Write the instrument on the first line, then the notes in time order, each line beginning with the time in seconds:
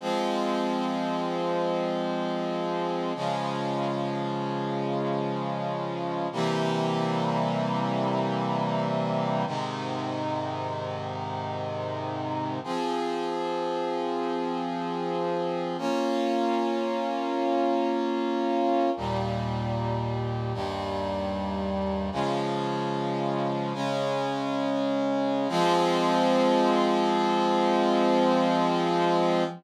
brass section
0.01 F3 G#3 C4
3.15 C#3 F3 G#3
6.32 C3 E3 G3 A#3
9.47 G#2 C3 D#3
12.64 F3 C4 G#4
15.78 A#3 C#4 F4
18.97 D#2 A#2 G3
20.54 D#2 G2 G3
22.12 C#3 F3 G#3
23.74 C#3 G#3 C#4
25.49 F3 G#3 C4